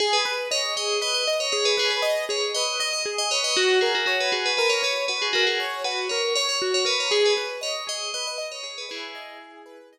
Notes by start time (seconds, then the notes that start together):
0.00 G#4
0.13 B4
0.25 B4
0.51 C#5 D#5
0.76 G#4 D#5
1.01 B4 D#5
1.14 D#5
1.27 D#5
1.40 C#5
1.52 G#4 C#5
1.65 B4
1.77 G#4 B4
1.90 B4
2.02 D#5
2.29 G#4 C#5
2.54 B4 D#5
2.80 D#5
2.93 D#5
3.06 G#4
3.18 D#5
3.31 B4 C#5
3.44 D#5
3.56 F#4
3.81 G#4 A#4
3.95 F#4
4.06 F#4 C#5
4.20 B4
4.32 F#4 G#4
4.46 B4
4.57 A#4 B4
4.69 C#5
4.83 B4 C#5
5.08 F#4 B4
5.22 G#4
5.33 F#4 A#4
5.47 G#4
5.60 C#5
5.84 F#4 B4
6.09 A#4 C#5
6.35 C#5
6.49 C#5
6.62 F#4
6.74 C#5
6.85 A#4 B4
7.00 C#5
7.11 G#4
7.26 B4
7.37 B4
7.61 C#5 D#5
7.87 G#4 D#5
8.14 B4 D#5
8.27 D#5
8.38 D#5
8.52 C#5
8.63 G#4 C#5
8.78 B4
8.89 E4 G#4 B4
9.15 D#5
9.40 G#4
9.66 B4
9.93 D#5